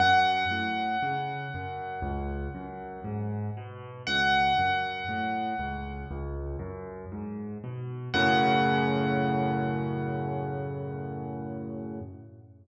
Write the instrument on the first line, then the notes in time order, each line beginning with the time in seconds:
acoustic grand piano
0.00 F#2 F#5
0.51 A2
1.02 C#3
1.54 F#2
2.02 C#2
2.55 F#2
3.04 G#2
3.57 B2
4.07 C#2 F#5
4.58 F#2
5.08 A2
5.59 C#2
6.11 C#2
6.59 F#2
7.12 G#2
7.64 B2
8.14 F#2 A2 C#3 F#5